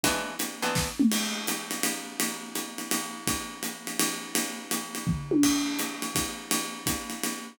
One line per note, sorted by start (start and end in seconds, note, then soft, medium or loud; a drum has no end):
0.03 0.35 E3 medium
0.03 0.35 G#3 medium
0.03 0.35 B3 medium
0.03 0.35 D4 medium
0.03 kick soft
0.03 ride medium
0.39 hi-hat pedal medium
0.39 ride medium
0.62 0.89 E3 medium
0.62 0.89 G#3 medium
0.62 0.89 B3 medium
0.62 0.89 D4 medium
0.62 ride medium
0.75 kick medium
0.75 snare medium
0.99 mid tom medium
1.12 crash medium
1.12 ride medium
1.47 hi-hat pedal medium
1.47 ride medium
1.71 ride medium
1.83 ride medium
2.20 ride medium
2.55 hi-hat pedal medium
2.55 ride medium
2.78 ride medium
2.91 ride medium
3.27 kick medium
3.27 ride medium
3.63 hi-hat pedal medium
3.63 ride medium
3.87 ride medium
3.99 ride medium
4.35 ride medium
4.71 hi-hat pedal medium
4.71 ride medium
4.95 ride medium
5.07 kick medium
5.07 floor tom medium
5.31 high tom medium
5.43 kick medium
5.43 crash medium
5.43 ride medium
5.79 hi-hat pedal medium
5.79 ride medium
6.02 ride medium
6.15 kick medium
6.15 ride medium
6.51 ride medium
6.86 kick medium
6.86 hi-hat pedal medium
6.86 ride medium
7.10 ride medium
7.23 ride medium